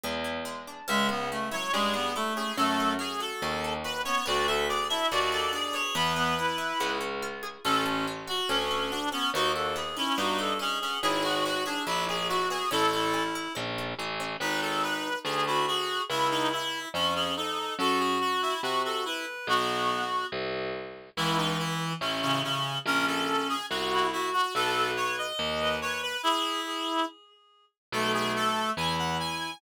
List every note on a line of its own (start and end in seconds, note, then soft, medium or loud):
0.04 0.82 E2 medium
0.04 0.45 G#3 medium
0.24 0.85 E4 medium
0.45 0.85 G#3 medium
0.67 0.87 D4 medium
0.88 1.65 C#2 loud
0.88 1.09 G#3 loud
0.88 1.31 C#4 loud
0.88 1.07 E5 medium
1.09 1.29 B3 medium
1.09 1.93 G#4 medium
1.31 1.49 A3 medium
1.31 1.73 C#4 medium
1.51 1.71 F#3 medium
1.51 2.15 E4 medium
1.51 1.72 C#5 medium
1.73 2.49 G2 medium
1.73 1.93 G#3 loud
1.73 2.36 C#4 medium
1.73 2.12 G#4 medium
1.94 2.14 B3 loud
1.94 2.54 G#4 medium
2.16 2.52 A3 loud
2.16 2.56 E4 medium
2.16 2.33 A4 medium
2.36 2.57 C#4 medium
2.36 2.57 G#4 medium
2.57 3.33 F#2 loud
2.57 2.94 A3 loud
2.57 2.98 C#4 medium
2.57 2.93 A4 medium
2.80 3.64 A4 medium
2.99 3.42 C#4 medium
2.99 3.20 G#4 medium
3.20 3.84 F#4 medium
3.20 3.73 A4 medium
3.42 4.18 D#2 medium
3.42 4.05 C#4 medium
3.64 4.24 A4 medium
3.84 4.24 F#4 medium
3.84 4.01 B4 medium
4.05 4.23 B3 medium
4.05 4.26 C#4 medium
4.05 4.25 C#5 medium
4.26 5.03 D2 loud
4.26 4.70 B3 medium
4.26 4.47 F#4 loud
4.26 4.47 D5 medium
4.47 5.32 F#4 medium
4.47 4.65 A4 loud
4.47 4.68 E5 medium
4.69 5.11 B3 medium
4.69 4.86 G#4 medium
4.69 4.88 D5 medium
4.89 5.52 D4 medium
4.89 5.10 E4 medium
4.89 5.07 E5 medium
5.11 5.88 D#2 medium
5.11 5.72 B3 medium
5.11 5.31 F#4 loud
5.11 5.31 D5 medium
5.32 5.92 F#4 medium
5.32 5.51 A4 medium
5.32 5.52 D5 medium
5.53 5.93 D4 medium
5.53 5.94 G#4 medium
5.53 5.75 D5 medium
5.73 5.93 B3 medium
5.73 5.94 C#5 medium
5.95 6.73 E2 loud
5.95 6.38 B3 medium
5.95 6.13 B3 loud
5.95 6.91 B4 medium
6.16 6.34 B3 loud
6.16 6.76 G#4 medium
6.38 6.79 B3 medium
6.38 6.98 E4 medium
6.58 6.78 E4 medium
6.80 7.58 C#2 loud
6.80 7.60 B3 medium
7.01 7.61 C#4 medium
7.22 7.63 F4 medium
7.43 7.63 G#4 medium
7.64 8.41 A1 loud
7.64 8.07 C#4 medium
7.64 8.05 C#4 loud
7.64 7.84 A4 medium
7.85 8.70 A4 medium
8.07 8.49 C#4 medium
8.27 8.91 F#4 medium
8.27 8.49 F#4 medium
8.49 9.25 D2 medium
8.49 9.12 C#4 medium
8.49 8.91 C#4 medium
8.71 9.31 A4 medium
8.91 9.09 D4 medium
8.91 9.32 F#4 medium
9.12 9.31 B3 medium
9.12 9.32 C#4 medium
9.12 9.30 C#4 medium
9.34 10.10 D#2 loud
9.34 9.75 B3 medium
9.34 9.52 D#4 medium
9.34 9.51 F#4 loud
9.55 10.38 F#4 medium
9.55 9.75 A4 medium
9.76 10.17 B3 medium
9.76 9.96 G#4 medium
9.97 10.17 C#4 medium
9.97 10.59 D#4 medium
9.97 10.17 E4 medium
10.18 10.94 G2 medium
10.18 10.82 B3 medium
10.18 10.53 D#4 medium
10.18 10.37 F#4 medium
10.38 10.99 F#4 medium
10.38 10.58 A4 loud
10.59 10.78 C#4 medium
10.59 10.99 D#4 medium
10.59 11.01 G#4 medium
10.81 11.03 B3 medium
10.81 10.98 C#4 medium
11.02 11.79 G#1 medium
11.02 11.45 B3 medium
11.02 11.23 E4 loud
11.02 11.23 G#4 medium
11.23 11.44 F#4 medium
11.23 12.08 G#4 medium
11.23 11.43 G#4 medium
11.45 11.86 B3 medium
11.45 11.64 F#4 loud
11.45 11.64 F#4 medium
11.66 11.85 D4 medium
11.66 12.30 E4 medium
11.66 11.83 G#4 medium
11.87 12.63 A#1 loud
11.87 12.50 B3 medium
11.87 12.07 E4 medium
11.87 12.05 E4 medium
12.08 12.27 G#4 loud
12.08 12.27 G#4 medium
12.08 12.69 G#4 medium
12.29 12.71 E4 medium
12.29 12.48 F#4 medium
12.29 12.66 F#4 medium
12.50 12.70 B3 medium
12.50 12.69 G#4 medium
12.71 13.48 A1 medium
12.71 13.13 C#4 loud
12.71 12.90 E4 loud
12.71 13.23 A4 medium
12.93 13.13 E4 loud
12.93 13.78 A4 medium
13.14 13.55 C#4 medium
13.14 13.52 E4 medium
13.35 13.99 E4 medium
13.55 13.94 A#1 medium
13.55 14.19 C#4 medium
13.78 14.38 A4 medium
13.99 14.37 A1 medium
13.99 14.39 E4 medium
14.20 14.40 C#4 medium
14.40 15.16 G#1 medium
14.40 15.09 D#4 loud
14.40 14.60 B4 medium
14.62 14.82 A4 medium
14.83 15.19 B4 medium
15.25 16.01 D2 medium
15.25 15.45 G#4 medium
15.46 15.66 E4 medium
15.46 15.66 F#4 loud
15.67 16.02 F#4 medium
15.67 16.04 G#4 loud
16.09 16.86 C#2 medium
16.09 16.28 E4 medium
16.09 16.80 E4 loud
16.31 16.49 D#4 medium
16.52 16.89 E4 medium
16.94 17.70 F2 medium
16.94 17.14 C#4 medium
17.15 17.35 C#4 medium
17.15 17.34 G#4 loud
17.36 17.75 D#4 medium
17.36 17.74 A4 medium
17.79 18.55 F#2 medium
17.79 18.54 F#4 loud
17.79 17.99 A4 medium
18.00 18.18 G#4 medium
18.21 18.41 F#4 medium
18.42 18.61 E4 medium
18.63 19.39 C3 medium
18.63 18.82 F#4 medium
18.84 19.04 F#4 medium
18.84 19.02 A4 medium
19.05 19.26 E4 medium
19.05 19.47 B4 medium
19.47 20.25 B1 loud
19.47 20.04 B3 loud
19.47 20.26 F#4 medium
20.32 21.10 C2 medium
21.17 21.93 C#2 medium
21.17 21.94 E3 loud
21.17 21.37 E4 medium
21.38 21.57 D#4 medium
21.59 21.93 E4 medium
22.01 22.77 A1 medium
22.01 22.21 C#4 medium
22.22 22.42 C#3 medium
22.22 22.41 C#4 medium
22.44 22.78 C#3 medium
22.44 22.78 C#4 medium
22.86 23.62 A#1 medium
22.86 23.55 C#4 loud
22.86 23.05 A#4 medium
23.07 23.48 A4 medium
23.49 23.66 G#4 medium
23.70 24.47 C2 medium
23.70 24.07 F#4 medium
23.92 24.11 E4 loud
24.12 24.30 E4 medium
24.12 24.52 F#4 medium
24.33 24.54 F#4 medium
24.55 25.33 B1 medium
24.55 24.91 A4 medium
24.55 25.26 B4 loud
24.97 25.16 C#5 medium
25.18 25.76 D#5 medium
25.39 26.17 D#2 loud
25.60 25.79 B4 medium
25.82 26.17 B4 medium
25.82 26.01 C#5 medium
26.03 26.22 B4 medium
26.23 27.05 E4 medium
26.23 26.60 G#4 loud
26.66 27.02 G#4 medium
27.92 28.70 B1 loud
27.92 28.72 A3 loud
27.92 28.12 A4 medium
28.14 28.32 G#4 medium
28.36 28.70 A4 medium
28.77 29.55 E2 loud
28.77 29.51 E4 medium
28.77 28.96 G#5 medium
28.99 29.17 F#5 medium
29.20 29.58 G#5 medium